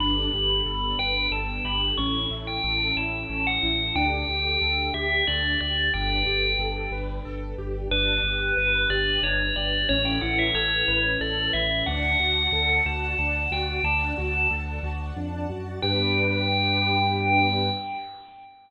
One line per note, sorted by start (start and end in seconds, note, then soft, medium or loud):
0.00 0.28 G1 loud
0.00 1.97 B3 medium
0.00 0.30 D4 loud
0.00 1.97 D4 medium
0.00 1.97 G4 medium
0.00 1.97 A4 medium
0.00 0.90 B5 medium
0.33 0.61 G1 loud
0.33 0.63 G4 medium
0.66 0.94 G1 medium
0.66 0.96 A4 medium
0.99 1.27 G1 medium
0.99 1.29 B4 medium
0.99 1.27 G5 medium
1.31 1.59 G1 medium
1.31 1.62 A4 medium
1.31 1.61 A5 medium
1.64 1.92 G1 medium
1.64 1.95 G4 medium
1.64 1.93 B5 medium
1.98 2.26 A1 loud
1.98 2.27 C#4 loud
1.98 3.95 C#4 medium
1.98 3.95 E4 medium
1.98 3.95 A4 medium
1.98 2.38 C#6 medium
2.31 2.59 A1 medium
2.31 2.61 E4 medium
2.47 2.92 G5 medium
2.64 2.92 A1 loud
2.64 2.93 A4 medium
2.96 3.24 A1 medium
2.96 3.26 E4 medium
2.96 3.41 A5 medium
3.30 3.58 A1 medium
3.30 3.59 C#4 medium
3.47 3.74 F#5 loud
3.63 3.91 A1 medium
3.63 3.92 E4 medium
3.95 4.23 D2 loud
3.95 5.91 D4 medium
3.95 4.25 D4 loud
3.95 5.91 G4 medium
3.95 5.91 A4 medium
3.95 4.77 G5 loud
4.28 4.56 D2 medium
4.28 4.58 G4 medium
4.61 4.89 D2 medium
4.61 4.91 A4 medium
4.94 5.22 D2 medium
4.94 5.24 G4 loud
4.94 5.26 E5 medium
5.27 5.56 D2 medium
5.27 5.57 D4 medium
5.27 5.54 D5 medium
5.60 5.89 D2 medium
5.60 5.90 G4 medium
5.60 5.91 D5 medium
5.93 6.23 G1 loud
5.93 7.89 D4 medium
5.93 6.23 D4 loud
5.93 7.89 G4 medium
5.93 7.89 A4 medium
5.93 7.89 B4 medium
5.93 6.56 G5 loud
6.26 6.54 G1 medium
6.26 6.56 G4 medium
6.59 6.87 G1 medium
6.59 6.89 A4 medium
6.91 7.19 G1 medium
6.91 7.22 B4 medium
7.25 7.54 G1 medium
7.25 7.55 A4 loud
7.58 7.87 G1 medium
7.58 7.88 G4 medium
7.91 8.19 G1 loud
7.91 9.87 D4 medium
7.91 8.21 D4 loud
7.91 9.87 G4 medium
7.91 9.87 B4 medium
7.91 8.83 B4 loud
8.23 8.51 G1 medium
8.23 8.54 G4 medium
8.57 8.85 G1 medium
8.57 8.87 B4 medium
8.90 9.18 G1 medium
8.90 9.20 G4 medium
8.90 9.19 D5 medium
9.23 9.51 G1 loud
9.23 9.53 D4 medium
9.23 9.53 C#5 medium
9.56 9.84 G1 medium
9.56 9.86 G4 medium
9.56 9.83 D5 medium
9.89 10.18 A1 loud
9.89 10.19 C#4 loud
9.89 11.86 C#4 medium
9.89 11.86 E4 medium
9.89 11.86 A4 medium
9.89 11.86 B4 medium
9.89 10.05 C#5 loud
10.05 10.21 G5 medium
10.21 10.50 A1 medium
10.21 10.52 E4 medium
10.21 10.37 F#5 loud
10.39 10.54 E5 medium
10.54 10.82 A1 medium
10.54 10.85 A4 medium
10.54 11.03 C#5 medium
10.88 11.16 A1 loud
10.88 11.18 B4 medium
11.20 11.48 A1 medium
11.20 11.51 A4 medium
11.20 11.50 D5 medium
11.53 11.82 A1 loud
11.53 11.84 E4 medium
11.53 11.84 E5 loud
11.86 12.15 D2 loud
11.86 12.16 D4 loud
11.86 13.83 D5 medium
11.86 12.70 F#5 loud
11.86 13.83 F#5 medium
11.86 13.83 A5 medium
12.19 12.47 D2 medium
12.19 12.50 F#4 medium
12.52 12.80 D2 loud
12.52 12.82 A4 medium
12.86 13.14 D2 loud
12.86 13.15 F#4 medium
12.86 13.18 A5 medium
13.19 13.47 D2 loud
13.19 13.48 D4 medium
13.19 13.48 A5 medium
13.51 13.79 D2 medium
13.51 13.81 F#4 medium
13.51 13.83 G5 medium
13.84 14.12 D2 loud
13.84 14.14 D4 loud
13.84 15.81 D5 medium
13.84 15.81 F#5 medium
13.84 14.47 A5 loud
13.84 15.81 A5 medium
14.18 14.47 D2 loud
14.18 14.47 F#4 medium
14.51 14.79 D2 loud
14.51 14.80 A4 medium
14.83 15.11 D2 loud
14.83 15.13 F#4 medium
15.16 15.46 F2 medium
15.16 15.46 D4 medium
15.50 15.80 F#2 medium
15.50 15.79 F#4 medium
15.82 17.70 G2 loud
15.82 17.69 B3 loud
15.82 17.69 D4 loud
15.82 17.69 G4 loud
15.82 17.69 B4 loud
15.82 17.69 G5 loud